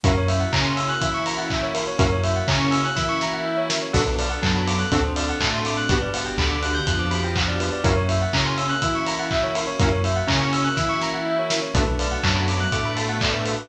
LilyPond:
<<
  \new Staff \with { instrumentName = "Lead 2 (sawtooth)" } { \time 4/4 \key b \minor \tempo 4 = 123 <ais cis' e' fis'>8 r8 cis'4 e'2 | <ais cis' e' fis'>8 r8 cis'4 e'2 | <b d' fis' a'>8 r8 fis4 <c' d' fis' a'>8 r8 a4 | <b d' fis' g'>8 r8 d4 f2 |
<ais cis' e' fis'>8 r8 cis'4 e'2 | <ais cis' e' fis'>8 r8 cis'4 e'2 | <a b d' fis'>8 r8 fis4 a2 | }
  \new Staff \with { instrumentName = "Tubular Bells" } { \time 4/4 \key b \minor ais'16 cis''16 e''16 fis''16 ais''16 c'''16 e'''16 fis'''16 e'''16 cis'''16 ais''16 fis''16 e''16 cis''16 ais'16 cis''16 | ais'16 cis''16 e''16 fis''16 ais''16 cis'''16 e'''16 fis'''16 e'''16 cis'''16 ais''16 fis''16 e''16 cis''16 ais'16 cis''16 | a'16 b'16 d''16 fis''16 a''16 b''16 d'''16 fis'''16 a'16 c''16 d''16 fis''16 a''16 c'''16 d'''16 fis'''16 | b'16 d''16 fis''16 g''16 b''16 d'''16 fis'''16 g'''16 fis'''16 d'''16 b''16 g''16 fis''16 d''16 b'16 d''16 |
ais'16 cis''16 e''16 fis''16 ais''16 c'''16 e'''16 fis'''16 e'''16 cis'''16 ais''16 fis''16 e''16 cis''16 ais'16 cis''16 | ais'16 cis''16 e''16 fis''16 ais''16 cis'''16 e'''16 fis'''16 e'''16 cis'''16 ais''16 fis''16 e''16 cis''16 ais'16 cis''16 | a'16 b'16 d''16 fis''16 a''16 b''16 d'''16 fis'''16 d'''16 b''16 a''16 fis''16 d''16 b'16 a'16 b'16 | }
  \new Staff \with { instrumentName = "Synth Bass 2" } { \clef bass \time 4/4 \key b \minor fis,4 cis4 e2 | fis,4 cis4 e2 | b,,4 fis,4 d,4 a,4 | g,,4 d,4 f,2 |
fis,4 cis4 e2 | fis,4 cis4 e2 | b,,4 fis,4 a,2 | }
  \new Staff \with { instrumentName = "String Ensemble 1" } { \time 4/4 \key b \minor <ais cis' e' fis'>1 | <ais cis' e' fis'>1 | <b d' fis' a'>2 <c' d' fis' a'>2 | <b d' fis' g'>1 |
<ais cis' e' fis'>1 | <ais cis' e' fis'>1 | <a b d' fis'>1 | }
  \new DrumStaff \with { instrumentName = "Drums" } \drummode { \time 4/4 <hh bd>8 hho8 <hc bd>8 hho8 <hh bd>8 hho8 <hc bd>8 hho8 | <hh bd>8 hho8 <hc bd>8 hho8 <bd sn>8 sn8 r8 sn8 | <cymc bd>8 hho8 <hc bd>8 hho8 <hh bd>8 hho8 <hc bd>8 hho8 | <hh bd>8 hho8 <hc bd>8 hho8 <hh bd>8 hho8 <hc bd>8 hho8 |
<hh bd>8 hho8 <hc bd>8 hho8 <hh bd>8 hho8 <hc bd>8 hho8 | <hh bd>8 hho8 <hc bd>8 hho8 <bd sn>8 sn8 r8 sn8 | <hh bd>8 hho8 <hc bd>8 hho8 <hh bd>8 hho8 <hc bd>8 hho8 | }
>>